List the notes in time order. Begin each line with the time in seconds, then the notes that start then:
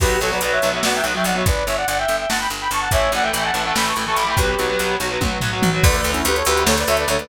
0.00 B1 F#3 B3 G4 B4, kick, crash
0.20 B1 F#3 B3 A4 C#5, closed hi-hat
0.31 F#3 B3 B4 D5
0.41 B1 F#3 B3 B4 D5, closed hi-hat
0.52 C#5 E5
0.62 B1 F#3 B3, closed hi-hat
0.73 F#3 B3 C#5 E5
0.83 B1 F#3 B3 D5 F#5, snare
0.95 E5 G5
1.04 B1 F#3 B3, closed hi-hat
1.14 F#3 B3 E5 G5
1.24 B1 D5 F#5, closed hi-hat
1.35 F#3 B3 C#5 E5
1.46 G1 B4 D5, kick, closed hi-hat
1.66 G1 C#5 E5, closed hi-hat
1.77 D5 F#5
1.88 G1 D5 F#5, closed hi-hat
1.98 E5 G5
2.08 G1, closed hi-hat
2.18 E5 G5
2.29 G1 F#5 A5, snare
2.39 G5 B5
2.50 G1, closed hi-hat
2.60 G5 B5
2.71 G1 A5 C#6, closed hi-hat
2.80 F#5 A5
2.91 A1 E3 A3 C#5 E5, kick, closed hi-hat
3.12 A1 E3 A3 D5 F#5, closed hi-hat
3.23 E3 A3 E5 G5
3.33 A1 E3 A3 E5 G5, closed hi-hat
3.44 F#5 A5
3.54 A1 E3 A3, closed hi-hat
3.64 E3 A3 F#5 A5
3.75 A1 E3 A3 G5 B5, snare
3.86 A5 C#6
3.96 A1 E3 A3, closed hi-hat
4.06 E3 A3 A5 C#6
4.16 A1 B5 D6, closed hi-hat
4.27 E3 A3 G5 B5
4.37 B1 F#3 B3 G4 B4, kick, closed hi-hat
4.59 B1 F#3 B3, closed hi-hat
4.69 F#3 B3
4.79 B1 F#3 B3, closed hi-hat
5.00 B1 F#3 B3, closed hi-hat
5.10 F#3 B3
5.21 B1 F#3 B3, kick, high tom
5.41 B1 F#3 B3, floor tom
5.52 F#3 B3
5.62 B1, mid tom
5.73 F#3 B3
5.83 D2 D3 A3 B4 D5, kick, crash
5.93 D3 A3, closed hi-hat
5.98 B4 D5
6.04 D2, closed hi-hat
6.12 C#4 E4, closed hi-hat
6.25 D2 G4 B4, closed hi-hat
6.35 A4 C#5, closed hi-hat
6.45 D2 G4 B4, closed hi-hat
6.56 D3 A3, closed hi-hat
6.66 D2 A4 C#5, snare
6.78 B4 D5, closed hi-hat
6.87 D2 D3 A3 C#5 E5, closed hi-hat
6.97 B4 D5, closed hi-hat
7.07 D2 D3 A3 A4 C#5, closed hi-hat
7.18 D3 A3 B4 D5, closed hi-hat